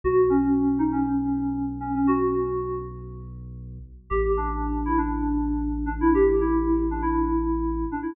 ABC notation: X:1
M:4/4
L:1/16
Q:1/4=118
K:G#m
V:1 name="Electric Piano 2"
F2 C4 D C7 C C | F6 z10 | [K:Am] G2 D4 E D7 D E | G2 E4 D E7 D E |]
V:2 name="Synth Bass 2" clef=bass
B,,,16- | B,,,16 | [K:Am] A,,,16- | A,,,16 |]